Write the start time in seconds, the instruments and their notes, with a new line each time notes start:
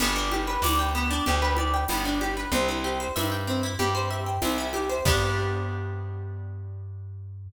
0.00 electric bass (finger) G1, acoustic guitar (steel) B3, crash, low conga
0.16 acoustic guitar (steel) D4
0.31 acoustic guitar (steel) G4, high conga
0.47 acoustic guitar (steel) B4
0.62 electric bass (finger) D2, acoustic guitar (steel) D5, tambourine, high conga
0.79 acoustic guitar (steel) G5
0.95 acoustic guitar (steel) B3
1.11 acoustic guitar (steel) D4
1.26 electric bass (finger) D2, acoustic guitar (steel) G4, low conga
1.42 acoustic guitar (steel) B4
1.57 acoustic guitar (steel) D5, high conga
1.74 acoustic guitar (steel) G5
1.88 electric bass (finger) G1, acoustic guitar (steel) B3, tambourine, high conga
2.05 acoustic guitar (steel) D4
2.21 acoustic guitar (steel) G4, high conga
2.37 acoustic guitar (steel) B4
2.52 electric bass (finger) C2, acoustic guitar (steel) C4, low conga
2.68 acoustic guitar (steel) E4
2.84 acoustic guitar (steel) G4
3.00 acoustic guitar (steel) C5
3.16 electric bass (finger) G2, acoustic guitar (steel) E5, tambourine, high conga
3.32 acoustic guitar (steel) G5
3.47 acoustic guitar (steel) C4
3.63 acoustic guitar (steel) E4
3.79 electric bass (finger) G2, acoustic guitar (steel) G4, low conga
3.95 acoustic guitar (steel) C5
4.11 acoustic guitar (steel) E5
4.26 acoustic guitar (steel) G5
4.42 electric bass (finger) C2, acoustic guitar (steel) C4, tambourine, high conga
4.58 acoustic guitar (steel) E4
4.73 acoustic guitar (steel) G4, high conga
4.89 acoustic guitar (steel) C5
5.05 electric bass (finger) G2, acoustic guitar (steel) B3 D4 G4, kick, crash